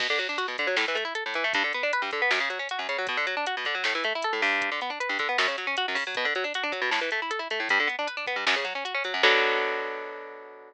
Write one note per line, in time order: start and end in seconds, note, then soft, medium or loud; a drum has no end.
0.00 0.07 B2 medium
0.00 kick loud
0.00 crash loud
0.10 0.19 D3 medium
0.19 0.27 F#3 medium
0.19 closed hi-hat medium
0.29 0.37 D4 medium
0.38 0.46 F#4 medium
0.38 closed hi-hat loud
0.48 0.56 B2 medium
0.58 0.67 D3 medium
0.58 kick medium
0.58 closed hi-hat medium
0.67 0.76 F#3 medium
0.77 0.85 A2 medium
0.77 snare loud
0.88 0.96 E3 medium
0.95 1.04 A3 medium
0.95 closed hi-hat medium
1.05 1.13 E4 medium
1.15 1.23 A4 medium
1.15 closed hi-hat loud
1.26 1.34 A2 medium
1.34 1.44 E3 medium
1.34 closed hi-hat medium
1.44 1.53 A3 medium
1.53 1.63 G2 medium
1.53 kick loud
1.53 closed hi-hat loud
1.64 1.73 D3 medium
1.73 1.83 B3 medium
1.73 closed hi-hat medium
1.83 1.92 D4 medium
1.93 2.02 B4 medium
1.93 closed hi-hat loud
2.02 2.10 G2 medium
2.11 2.21 D3 medium
2.11 kick medium
2.11 closed hi-hat medium
2.22 2.30 B3 medium
2.31 2.39 F#2 medium
2.31 snare loud
2.40 2.49 C#3 medium
2.50 2.58 F#3 medium
2.50 closed hi-hat medium
2.59 2.68 C#4 medium
2.69 2.79 F#4 medium
2.69 closed hi-hat loud
2.79 2.87 F#2 medium
2.88 2.97 C#3 medium
2.88 closed hi-hat medium
2.98 3.07 F#3 medium
3.07 3.17 B2 medium
3.07 kick loud
3.07 closed hi-hat loud
3.17 3.26 D3 medium
3.27 3.35 F#3 medium
3.27 closed hi-hat medium
3.37 3.45 D4 medium
3.46 3.55 F#4 medium
3.46 closed hi-hat loud
3.57 3.66 B2 medium
3.65 3.74 D3 medium
3.65 kick medium
3.65 closed hi-hat medium
3.75 3.83 F#3 medium
3.84 3.93 A2 medium
3.84 snare loud
3.95 4.03 E3 medium
4.04 4.13 A3 medium
4.04 closed hi-hat medium
4.15 4.24 E4 medium
4.22 4.33 A4 medium
4.22 closed hi-hat loud
4.33 4.41 A2 medium
4.42 4.70 G2 medium
4.42 open hi-hat medium
4.61 kick loud
4.61 closed hi-hat loud
4.71 4.80 D3 medium
4.81 4.90 B3 medium
4.81 closed hi-hat medium
4.90 4.99 D4 medium
5.00 5.09 B4 medium
5.00 closed hi-hat loud
5.09 5.18 G2 medium
5.19 5.28 D3 medium
5.19 kick loud
5.19 closed hi-hat medium
5.29 5.37 B3 medium
5.38 5.47 F#2 medium
5.38 snare loud
5.48 5.56 C#3 medium
5.58 5.66 F#3 medium
5.58 closed hi-hat medium
5.67 5.75 C#4 medium
5.77 5.86 F#4 medium
5.77 closed hi-hat loud
5.88 5.96 F#2 medium
5.95 6.04 C#3 medium
5.95 open hi-hat medium
6.07 6.15 F#3 medium
6.15 6.25 B2 medium
6.15 kick loud
6.15 closed hi-hat loud
6.25 6.33 D3 medium
6.35 6.44 F#3 medium
6.35 closed hi-hat medium
6.44 6.53 D4 medium
6.54 6.64 F#4 medium
6.54 closed hi-hat loud
6.63 6.72 D4 medium
6.72 6.81 F#3 medium
6.72 kick medium
6.72 closed hi-hat medium
6.81 6.90 B2 medium
6.91 7.00 A2 medium
6.91 snare loud
7.01 7.10 E3 medium
7.11 7.20 A3 medium
7.11 closed hi-hat medium
7.22 7.31 E4 medium
7.30 7.39 A4 medium
7.30 closed hi-hat loud
7.39 7.48 E4 medium
7.50 7.59 A3 medium
7.50 closed hi-hat medium
7.60 7.68 A2 medium
7.69 7.79 G2 medium
7.69 kick loud
7.69 closed hi-hat loud
7.79 7.88 D3 medium
7.87 7.96 B3 medium
7.87 closed hi-hat medium
7.98 8.07 D4 medium
8.07 8.16 B4 medium
8.07 closed hi-hat loud
8.17 8.25 D4 medium
8.27 8.36 B3 medium
8.27 kick medium
8.27 closed hi-hat medium
8.36 8.45 G2 medium
8.46 8.55 F#2 medium
8.46 snare loud
8.56 8.65 C#3 medium
8.65 8.73 F#3 medium
8.65 closed hi-hat medium
8.75 8.84 C#4 medium
8.85 8.93 F#4 medium
8.85 closed hi-hat loud
8.94 9.03 C#4 medium
9.04 9.13 F#3 medium
9.04 closed hi-hat medium
9.14 9.22 F#2 medium
9.23 10.73 B2 loud
9.23 10.73 D3 medium
9.23 10.73 F#3 loud
9.23 kick loud
9.23 crash loud